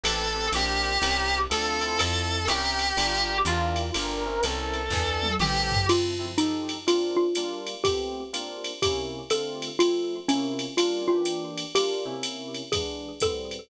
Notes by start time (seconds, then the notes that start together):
0.03 A1 C4 G4 A4 B4, ride
0.34 C4 G4 A4 B4
0.52 A#1 C4 D4 F4 G4 A#4, hi-hat pedal, ride
0.84 ride
1.01 C2 C4 C#4 E4 A#4, ride
1.50 D2 C4 D4 F4 A4, hi-hat pedal, ride
1.81 C4 E4 F4 A4, ride
1.99 F2 A4, ride
2.47 C2 C4 C#4 E4 G4 A#4, hi-hat pedal, ride
2.79 ride
2.97 G1 D4 F4 G4 A#4, ride
3.45 E2 D4 E4 F4 G4 A#4, hi-hat pedal, ride
3.76 ride
3.94 G1 D4 F4 G4 A#4, ride
4.26 C4 C#4 E4 A#4
4.43 C2 A4, hi-hat pedal, ride
4.74 ride
4.90 E2 B3 D4 E4 G#4, kick, snare
5.23 high tom
5.39 A1 B3 C4 G4 A4, mid tom
5.72 floor tom
5.89 F3 C4 E4 F4 A4, crash, ride
6.19 F3 C4 E4 A4
6.38 F3 D#4 G4 A4, hi-hat pedal, ride
6.69 ride
6.87 A#3 C4 D4 F4, ride
7.17 F4
7.35 G3 A#3 D4 F4, hi-hat pedal, ride
7.67 ride
7.84 A3 B3 C4 G4, kick, ride
8.33 A#3 C4 D4 F4, hi-hat pedal, ride
8.64 ride
8.82 C3 A#3 C#4 E4 G4, kick, ride
9.30 D3 A3 C4 F4 A4, hi-hat pedal, ride
9.62 ride
9.79 F3 A3 C4 E4 F4, ride
10.28 C3 A#3 C#4 E4, hi-hat pedal, ride
10.59 ride
10.77 G3 A#3 D4 F4, ride
11.08 E3 A#3 D4 F4 G4
11.25 hi-hat pedal, ride
11.58 ride
11.75 G3 A#3 D4 F4 G4, ride
12.05 C3 A#3 C#4 E4
12.23 hi-hat pedal, ride
12.54 ride
12.72 E3 G#3 B3 D4 G#4, kick, ride
13.20 A2 G3 B3 C4 A4, kick, hi-hat pedal, ride
13.51 ride